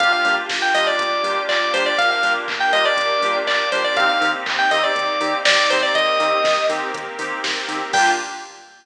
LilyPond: <<
  \new Staff \with { instrumentName = "Electric Piano 2" } { \time 4/4 \key g \minor \tempo 4 = 121 f''16 f''8 r8 g''16 ees''16 d''4~ d''16 d''8 c''16 d''16 | f''16 f''8 r8 g''16 ees''16 d''4~ d''16 d''8 c''16 d''16 | f''16 f''8 r8 g''16 ees''16 d''4~ d''16 d''8 c''16 d''16 | ees''4. r2 r8 |
g''4 r2. | }
  \new Staff \with { instrumentName = "Electric Piano 2" } { \time 4/4 \key g \minor <bes d' f' g'>8 <bes d' f' g'>4 <bes d' f' g'>4 <bes d' f' g'>4 <bes d' f' g'>8~ | <bes d' f' g'>8 <bes d' f' g'>4 <bes d' f' g'>4 <bes d' f' g'>4 <bes d' f' g'>8 | <bes c' ees' g'>8 <bes c' ees' g'>4 <bes c' ees' g'>4 <bes c' ees' g'>4 <bes c' ees' g'>8~ | <bes c' ees' g'>8 <bes c' ees' g'>4 <bes c' ees' g'>4 <bes c' ees' g'>4 <bes c' ees' g'>8 |
<bes d' f' g'>4 r2. | }
  \new Staff \with { instrumentName = "Synth Bass 1" } { \clef bass \time 4/4 \key g \minor g,,8 g,8 g,,8 g,8 g,,8 g,8 g,,8 g,8 | g,,8 g,8 g,,8 g,8 g,,8 g,8 g,,8 g,8 | ees,8 ees8 ees,8 ees8 ees,8 ees8 ees,8 ees8 | ees,8 ees8 ees,8 ees8 ees,8 ees8 ees,8 ees8 |
g,4 r2. | }
  \new Staff \with { instrumentName = "Pad 5 (bowed)" } { \time 4/4 \key g \minor <bes d' f' g'>1 | <bes d' g' bes'>1 | <bes c' ees' g'>1 | <bes c' g' bes'>1 |
<bes d' f' g'>4 r2. | }
  \new DrumStaff \with { instrumentName = "Drums" } \drummode { \time 4/4 <hh bd>8 hho8 <bd sn>8 hho8 <hh bd>8 hho8 <hc bd>8 hho8 | <hh bd>8 hho8 <hc bd>8 hho8 <hh bd>8 hho8 <hc bd>8 hho8 | <hh bd>8 hho8 <hc bd>8 hho8 <hh bd>8 hho8 <bd sn>8 hho8 | <hh bd>8 hho8 <bd sn>8 hho8 <hh bd>8 hho8 <bd sn>8 hho8 |
<cymc bd>4 r4 r4 r4 | }
>>